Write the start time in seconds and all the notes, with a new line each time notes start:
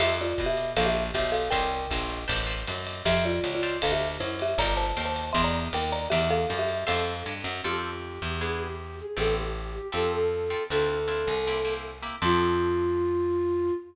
0.00 F2 G4 C5 E5 F5 A5, ride
0.21 F4 D5
0.38 B2, kick, hi-hat pedal, ride
0.46 G4 E5
0.57 ride
0.77 A#1 A4 C5 D5 F5 A#5, ride
0.86 G4 E5
1.14 B1 G4 C5 D5 E5 F5 A#5, kick, hi-hat pedal, ride
1.32 A4 F5, ride
1.50 C2 A#4 C5 C#5 E5 G5 A#5, kick, ride
1.90 A#1 C5 C#5 E5 A#5, kick, hi-hat pedal, ride
2.10 ride
2.28 A1 B4 C5 G5 A5, kick, ride
2.46 B4 C5 G5 A5
2.67 F#2, hi-hat pedal, ride
2.87 ride
3.05 F2 G4 C5 E5 F5 A5, kick, ride
3.25 F4 D5
3.43 C#2, hi-hat pedal, ride
3.55 F4 D5
3.63 C5 D5 E5 F5, ride
3.82 D2 A4 F5, kick, ride
3.92 G4 E5
4.20 F#2 E4 C5, hi-hat pedal, ride
4.39 G4 E5, ride
4.58 G1 A4 A#4 D5 F5 G5 A#5, kick, ride
4.77 C5 A5
4.97 D#2 A4 A#4 F5 G5, hi-hat pedal, ride
5.05 C5 A5
5.16 ride
5.33 E2 A#4 D5 E5 G5 C6, kick, ride
5.44 D5 A#5
5.73 D#2 A#4 G5, hi-hat pedal, ride
5.92 D5 A#5, ride
6.10 E2 G4 A#4 D5 E5 G5, ride
6.30 A4 F5
6.49 F#2, hi-hat pedal, ride
6.59 G4 E5
6.69 ride
6.87 F2 A4 C5 E5 F5, ride
7.26 G2, hi-hat pedal, ride
7.44 F#2, ride
7.64 F2 C4 F4 G4 A4
8.22 E2
8.41 B3 D4 E4 G#4
8.60 G4
9.00 G#4
9.17 A1 B3 C4 G4 A4
9.37 G4
9.75 G4
9.92 F2 C4 F4 G4 A4
10.13 A4
10.50 C4 F4 G4 A4
10.70 D2 C4 D4 E4 F4 A4
11.08 C4 D4 E4 F4
11.27 C2
11.47 A#3 C4 E4 G4
11.65 A#3 C4 E4 G4
12.02 A#3 C4 E4 G4
12.22 F2 C4 F4 G4 A4